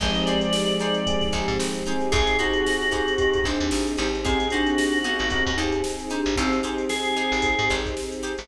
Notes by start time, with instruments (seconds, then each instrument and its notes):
0.00 electric bass (finger) G#1, glockenspiel F3 G#3, string ensemble 1 C4 D#4 G4 G#4, electric piano 1 C4 D#4 G4 G#4, acoustic guitar (steel) D#4 G4 G#4 C5, drawbar organ D#5, kick, crash
0.15 closed hi-hat
0.26 acoustic guitar (steel) D#4 G4 G#4 C5, drawbar organ D5, closed hi-hat
0.41 closed hi-hat
0.53 snare
0.70 closed hi-hat
0.79 acoustic guitar (steel) D#4 G4 G#4 C5, drawbar organ D5, closed hi-hat
0.94 closed hi-hat
1.06 electric piano 1 C4 D#4 G4 G#4, kick, closed hi-hat
1.21 kick, snare, closed hi-hat
1.32 electric bass (finger) G#1, acoustic guitar (steel) D#4 G4 G#4 C5, kick, closed hi-hat
1.48 electric bass (finger) G#2, snare, closed hi-hat
1.59 electric bass (finger) G#1, snare
1.75 closed hi-hat
1.86 electric piano 1 C4 D#4 G4 G#4, acoustic guitar (steel) D#4 G4 G#4 C5, closed hi-hat
2.00 snare, closed hi-hat
2.12 electric bass (finger) G#1, string ensemble 1 C4 D#4 G4 G#4, acoustic guitar (steel) D#4 G4 G#4 C5, drawbar organ G#4, glockenspiel G#4, kick, closed hi-hat
2.27 snare, closed hi-hat
2.39 acoustic guitar (steel) D#4 G4 G#4 C5, glockenspiel D#4, drawbar organ F#4, closed hi-hat
2.53 closed hi-hat
2.66 snare
2.82 closed hi-hat
2.91 acoustic guitar (steel) D#4 G4 G#4 C5, drawbar organ F#4, glockenspiel G#4, kick, closed hi-hat
3.08 closed hi-hat
3.18 electric piano 1 C4 D#4 G4 G#4, glockenspiel G4, kick, closed hi-hat
3.34 kick, closed hi-hat
3.44 electric bass (finger) G#1, glockenspiel D4, acoustic guitar (steel) D#4 G4 G#4 C5, kick, snare, closed hi-hat
3.60 electric bass (finger) D#2, closed hi-hat
3.71 electric bass (finger) G#1, snare
3.87 closed hi-hat
3.97 electric bass (finger) G#1, acoustic guitar (steel) D#4 G4 G#4 C5, glockenspiel D#4, closed hi-hat
4.15 closed hi-hat
4.25 string ensemble 1 C4 D#4 G4 G#4, glockenspiel C4, electric piano 1 C4 D#4 G4 G#4, acoustic guitar (steel) D#4 G4 G#4 C5, drawbar organ G#4, kick, closed hi-hat
4.40 closed hi-hat
4.50 glockenspiel D4, acoustic guitar (steel) D#4 G4 G#4 C5, drawbar organ F#4, closed hi-hat
4.66 closed hi-hat
4.78 snare
4.92 snare, closed hi-hat
5.04 glockenspiel B3, acoustic guitar (steel) D#4 G4 G#4 C5, drawbar organ F#4, closed hi-hat
5.19 electric bass (finger) G#1, closed hi-hat
5.30 electric piano 1 C4 D#4 G4 G#4, glockenspiel C4, kick, closed hi-hat
5.46 electric bass (finger) D#2, kick, closed hi-hat
5.57 electric bass (finger) D#2, glockenspiel D#4, acoustic guitar (steel) D#4 G4 G#4 C5, closed hi-hat
5.72 closed hi-hat
5.84 snare
5.99 closed hi-hat
6.10 glockenspiel D4, acoustic guitar (steel) D#4 G4 G#4 C5, closed hi-hat
6.26 electric bass (finger) G#1, closed hi-hat
6.36 electric bass (finger) G#1, glockenspiel C4 D#4, string ensemble 1 C4 D#4 G4 G#4, drawbar organ C4, acoustic guitar (steel) D#4 G4 G#4 C5, kick, closed hi-hat
6.53 closed hi-hat
6.63 acoustic guitar (steel) D#4 G4 G#4 C5, closed hi-hat
6.78 closed hi-hat
6.89 drawbar organ G#4, snare
7.05 closed hi-hat
7.16 acoustic guitar (steel) D#4 G4 G#4 C5, closed hi-hat
7.32 electric bass (finger) G#1, snare, closed hi-hat
7.42 kick, closed hi-hat
7.59 electric bass (finger) G#2, closed hi-hat
7.69 electric bass (finger) G#1, acoustic guitar (steel) D#4 G4 G#4 C5, kick, snare, closed hi-hat
7.86 kick, closed hi-hat
7.97 snare
8.12 closed hi-hat
8.23 acoustic guitar (steel) D#4 G4 G#4 C5, closed hi-hat
8.38 electric bass (finger) G#1, snare, open hi-hat